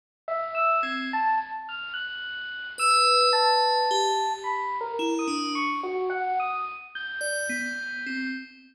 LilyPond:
<<
  \new Staff \with { instrumentName = "Electric Piano 1" } { \time 5/8 \tempo 4 = 54 r16 e''16 e'''16 gis'''16 a''16 r16 f'''16 fis'''8. | e'''8 a''4 \tuplet 3/2 { b''8 ais'8 dis'''8 } | cis'''16 fis'16 fis''16 dis'''16 r16 g'''4~ g'''16 | }
  \new Staff \with { instrumentName = "Tubular Bells" } { \time 5/8 r8. c'16 r4. | b'4 g'8 r8 e'16 d'16 | r4. d''16 b8 c'16 | }
>>